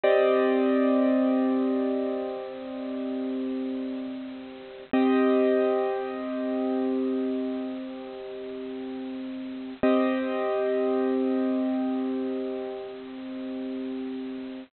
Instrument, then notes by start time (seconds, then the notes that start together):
acoustic grand piano
0.03 C4 G4 D5 D#5
4.93 C4 G4 D#5
9.83 C4 G4 D#5